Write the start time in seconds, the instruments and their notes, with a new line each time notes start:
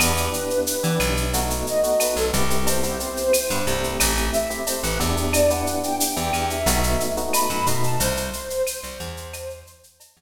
0.00 electric bass (finger) E2, electric piano 1 B3 D4 E4 G4, flute B4, cowbell, claves, shaker
0.17 electric piano 1 B3 D4 E4 G4, shaker
0.33 shaker
0.50 shaker
0.67 shaker
0.83 electric bass (finger) E3, electric piano 1 B3 D4 E4 G4, shaker
1.00 electric bass (finger) B1, claves, shaker
1.17 shaker
1.33 electric piano 1 A3 B3 D#4 F#4, cowbell, shaker
1.50 shaker
1.67 flute D#5, shaker
1.83 electric piano 1 A3 B3 D#4 F#4, shaker
2.00 flute B4, cowbell, claves, shaker
2.16 electric bass (finger) B1, flute A4, shaker
2.33 electric bass (finger) C2, electric piano 1 B3 C4 E4 G4, cowbell, shaker
2.50 shaker
2.67 flute C5, cowbell, shaker
2.83 electric piano 1 B3 C4 E4 G4, shaker
3.00 shaker
3.17 shaker
3.33 claves, shaker
3.50 electric bass (finger) G2, electric piano 1 B3 C4 E4 G4, shaker
3.67 electric bass (finger) C2, electric piano 1 A3 C4 E4 G4, shaker
3.83 shaker
4.00 electric bass (finger) A1, cowbell, claves, shaker
4.17 shaker
4.33 flute E5, shaker
4.50 electric piano 1 A3 C4 E4 G4, shaker
4.67 flute C5, cowbell, shaker
4.83 electric bass (finger) A1, flute B4, shaker
5.00 electric bass (finger) E2, electric piano 1 B3 D4 E4 G4, cowbell, shaker
5.17 shaker
5.33 flute D5, cowbell, claves, shaker
5.50 electric piano 1 B3 D4 E4 G4, flute F#5, shaker
5.67 shaker
5.83 flute G5, shaker
6.00 shaker
6.17 electric bass (finger) E2, electric piano 1 B3 D4 E4 G4, shaker
6.33 electric bass (finger) E2, claves, shaker
6.50 flute E5, shaker
6.66 electric bass (finger) B1, electric piano 1 A3 B3 D#4 F#4, cowbell, shaker
6.83 shaker
7.00 shaker
7.17 electric piano 1 A3 B3 D#4 F#4, shaker
7.33 flute B5, cowbell, claves, shaker
7.50 electric bass (finger) F#2, shaker
7.66 electric bass (finger) B2, electric piano 1 A3 B3 D#4 F#4, cowbell, shaker
7.83 flute A5, shaker
8.00 electric bass (finger) C2, flute C5, cowbell, shaker
8.17 shaker
8.33 shaker
8.50 shaker
8.67 claves, shaker
8.83 electric bass (finger) C2, shaker
9.00 electric bass (finger) E2, shaker
9.17 shaker
9.33 cowbell, claves, shaker
9.50 shaker
9.67 shaker
9.83 shaker
10.00 cowbell, shaker
10.17 electric bass (finger) E2, shaker